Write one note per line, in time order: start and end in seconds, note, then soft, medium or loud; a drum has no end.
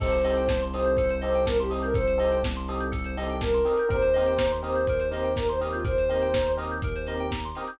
0.00 3.60 C2 loud
0.00 0.08 C4 loud
0.00 0.08 D#4 loud
0.00 0.08 G4 loud
0.00 0.08 A4 loud
0.00 0.11 A4 loud
0.00 0.60 C5 medium
0.00 kick loud
0.00 crash medium
0.11 0.22 C5 medium
0.11 closed hi-hat medium
0.24 0.42 C4 medium
0.24 0.42 D#4 medium
0.24 0.42 G4 medium
0.24 0.42 A4 medium
0.24 0.35 D#5 medium
0.24 open hi-hat medium
0.36 0.48 G5 medium
0.36 closed hi-hat medium
0.48 0.60 A5 medium
0.48 kick medium
0.48 snare loud
0.61 0.73 C6 medium
0.61 closed hi-hat medium
0.73 0.91 C4 medium
0.73 0.91 D#4 medium
0.73 0.91 G4 medium
0.73 0.91 A4 medium
0.73 1.14 C5 medium
0.73 0.85 D#6 loud
0.73 open hi-hat medium
0.85 0.97 G6 medium
0.85 closed hi-hat medium
0.97 1.08 A4 medium
0.97 kick medium
0.97 closed hi-hat loud
1.09 1.21 C5 medium
1.09 closed hi-hat medium
1.21 1.40 C4 medium
1.21 1.40 D#4 loud
1.21 1.40 G4 medium
1.21 1.40 A4 medium
1.21 1.44 C5 medium
1.21 1.32 D#5 medium
1.21 open hi-hat medium
1.34 1.46 G5 loud
1.34 closed hi-hat medium
1.46 1.58 A#4 medium
1.46 1.57 A5 loud
1.46 kick medium
1.46 snare loud
1.59 1.71 G4 medium
1.59 1.71 C6 medium
1.59 closed hi-hat medium
1.70 1.88 C4 medium
1.70 1.88 D#4 medium
1.70 1.88 G4 medium
1.70 1.88 A4 medium
1.70 1.81 D#6 medium
1.70 open hi-hat medium
1.82 1.95 A#4 medium
1.82 1.93 G6 medium
1.82 closed hi-hat medium
1.94 2.05 A4 loud
1.94 2.38 C5 medium
1.94 kick loud
1.94 closed hi-hat medium
2.07 2.18 C5 medium
2.07 closed hi-hat medium
2.18 2.35 C4 medium
2.18 2.35 D#4 medium
2.18 2.35 G4 medium
2.18 2.35 A4 medium
2.18 2.30 D#5 medium
2.18 open hi-hat medium
2.32 2.43 G5 medium
2.32 closed hi-hat medium
2.44 2.55 A5 medium
2.44 kick medium
2.44 snare loud
2.56 2.67 C6 medium
2.56 closed hi-hat medium
2.68 2.86 C4 medium
2.68 2.86 D#4 medium
2.68 2.86 G4 loud
2.68 2.86 A4 medium
2.68 2.80 D#6 medium
2.68 open hi-hat medium
2.80 2.91 G6 loud
2.80 closed hi-hat medium
2.92 3.03 A4 loud
2.92 kick medium
2.92 closed hi-hat loud
3.04 3.16 C5 medium
3.04 closed hi-hat medium
3.17 3.34 C4 loud
3.17 3.34 D#4 medium
3.17 3.34 G4 medium
3.17 3.34 A4 medium
3.17 3.28 D#5 loud
3.17 open hi-hat medium
3.29 3.41 G5 medium
3.29 closed hi-hat medium
3.41 3.88 A#4 medium
3.41 3.53 A5 medium
3.41 kick medium
3.41 snare loud
3.54 3.65 C6 medium
3.54 closed hi-hat medium
3.65 3.74 C4 medium
3.65 3.74 D#4 medium
3.65 3.74 G4 medium
3.65 3.74 A4 medium
3.65 3.77 D#6 medium
3.65 open hi-hat medium
3.77 3.90 G6 medium
3.77 closed hi-hat medium
3.89 7.49 D#2 medium
3.89 3.97 C4 loud
3.89 3.97 D#4 loud
3.89 3.97 G4 loud
3.89 3.97 A#4 loud
3.89 4.01 A#4 loud
3.89 4.52 C5 medium
3.89 kick medium
3.89 closed hi-hat medium
4.02 4.13 C5 medium
4.02 closed hi-hat medium
4.14 4.33 C4 medium
4.14 4.33 D#4 medium
4.14 4.33 G4 medium
4.14 4.33 A#4 medium
4.14 4.25 D#5 medium
4.14 open hi-hat medium
4.26 4.38 G5 medium
4.26 closed hi-hat medium
4.38 4.50 A#5 loud
4.38 kick medium
4.38 snare loud
4.51 4.62 C6 medium
4.51 closed hi-hat medium
4.62 4.79 C4 medium
4.62 4.79 D#4 medium
4.62 4.79 G4 medium
4.62 4.79 A#4 medium
4.62 5.08 C5 medium
4.62 4.74 D#6 medium
4.62 open hi-hat medium
4.76 4.87 G6 loud
4.76 closed hi-hat medium
4.87 5.00 A#4 loud
4.87 kick medium
4.87 closed hi-hat medium
4.99 5.11 C5 medium
4.99 closed hi-hat medium
5.11 5.28 C4 medium
5.11 5.28 D#4 medium
5.11 5.28 G4 medium
5.11 5.28 A#4 medium
5.11 5.33 C5 medium
5.11 5.24 D#5 medium
5.11 open hi-hat medium
5.24 5.35 G5 medium
5.24 closed hi-hat medium
5.36 5.48 A#4 medium
5.36 5.47 A#5 loud
5.36 kick medium
5.36 snare medium
5.49 5.60 C5 medium
5.49 5.60 C6 loud
5.49 closed hi-hat medium
5.61 5.78 C4 loud
5.61 5.78 D#4 medium
5.61 5.78 G4 medium
5.61 5.78 A#4 medium
5.61 5.72 D#6 medium
5.61 open hi-hat medium
5.72 5.85 F4 medium
5.72 5.83 G6 medium
5.72 closed hi-hat medium
5.84 5.95 A#4 loud
5.84 6.52 C5 medium
5.84 kick loud
5.84 closed hi-hat medium
5.98 6.10 C5 medium
5.98 closed hi-hat medium
6.09 6.26 C4 medium
6.09 6.26 D#4 medium
6.09 6.26 G4 medium
6.09 6.26 A#4 medium
6.09 6.21 D#5 medium
6.09 open hi-hat medium
6.22 6.33 G5 medium
6.22 closed hi-hat medium
6.34 6.46 A#5 medium
6.34 kick medium
6.34 snare loud
6.47 6.58 C6 medium
6.47 closed hi-hat medium
6.57 6.74 C4 medium
6.57 6.74 D#4 medium
6.57 6.74 G4 medium
6.57 6.74 A#4 loud
6.57 6.70 D#6 medium
6.57 open hi-hat medium
6.71 6.82 G6 loud
6.71 closed hi-hat medium
6.82 6.94 A#4 loud
6.82 kick medium
6.82 closed hi-hat loud
6.96 7.07 C5 loud
6.96 closed hi-hat medium
7.07 7.25 C4 medium
7.07 7.25 D#4 medium
7.07 7.25 G4 loud
7.07 7.25 A#4 medium
7.07 7.18 D#5 loud
7.07 open hi-hat medium
7.19 7.31 G5 loud
7.19 closed hi-hat medium
7.31 7.42 A#5 loud
7.31 kick medium
7.31 snare loud
7.44 7.56 C6 medium
7.44 closed hi-hat medium
7.55 7.65 C4 medium
7.55 7.65 D#4 medium
7.55 7.65 G4 medium
7.55 7.65 A#4 medium
7.55 7.68 D#6 medium
7.55 open hi-hat medium
7.67 7.79 G6 medium
7.67 closed hi-hat medium